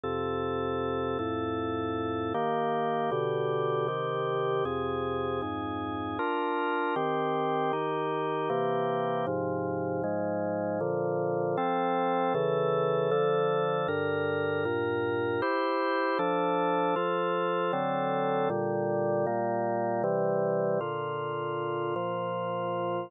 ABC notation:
X:1
M:3/4
L:1/8
Q:1/4=78
K:Bb
V:1 name="Drawbar Organ"
[F,,C,A]3 [F,,A,,A]3 | [K:Eb] [E,B,G]2 [=B,,D,G]2 [C,E,G]2 | [F,,C,A]2 [F,,A,,A]2 [DFB]2 | [E,CG]2 [E,EG]2 [C,=E,B,G]2 |
[A,,C,F,]2 [A,,F,A,]2 [B,,D,F,]2 | [K:F] [F,CA]2 [^C,E,A]2 [D,F,A]2 | [G,,D,B]2 [G,,B,,B]2 [EGc]2 | [F,DA]2 [F,FA]2 [D,^F,CA]2 |
[B,,D,G,]2 [B,,G,B,]2 [C,E,G,]2 | [K:Bb] [B,,D,F]3 [B,,F,F]3 |]